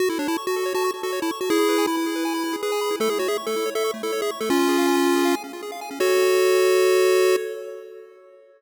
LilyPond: <<
  \new Staff \with { instrumentName = "Lead 1 (square)" } { \time 4/4 \key fis \minor \tempo 4 = 160 fis'16 e'16 d'16 e'16 r16 fis'8. fis'8 r16 fis'8 e'16 r16 fis'16 | <e' gis'>4 e'2 gis'4 | a'16 gis'16 fis'16 gis'16 r16 a'8. a'8 r16 a'8 gis'16 r16 a'16 | <cis' eis'>2~ <cis' eis'>8 r4. |
fis'1 | }
  \new Staff \with { instrumentName = "Lead 1 (square)" } { \time 4/4 \key fis \minor fis'16 a'16 cis''16 a''16 cis'''16 fis'16 a'16 cis''16 a''16 cis'''16 fis'16 a'16 cis''16 a''16 cis'''16 fis'16 | e'16 gis'16 b'16 gis''16 b''16 e'16 gis'16 b'16 gis''16 b''16 e'16 gis'16 b'16 gis''16 b''16 e'16 | a16 e'16 cis''16 e''16 cis'''16 a16 e'16 cis''16 e''16 cis'''16 a16 e'16 cis''16 e''16 cis'''16 a16 | cis'16 eis'16 gis'16 eis''16 gis''16 cis'16 eis'16 gis'16 eis''16 gis''16 cis'16 eis'16 gis'16 eis''16 gis''16 cis'16 |
<fis' a' cis''>1 | }
>>